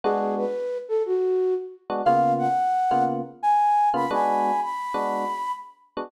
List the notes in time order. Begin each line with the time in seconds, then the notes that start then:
0.04 G#3 B3 D4 F#4 G#4
0.36 B4
0.89 A4
1.06 F#4
1.90 G#3 B3 D4 F#4
2.05 C#3 A#3 B3 F4 F5
2.38 F#5
2.91 C#3 A#3 B3 F4
3.43 G#5
3.94 C#3 A#3 B3 F4 B5
4.11 G#3 B3 D4 F#4 G#5 B5
4.60 B5
4.94 G#3 B3 D4 F#4
5.97 G#3 B3 D4 F#4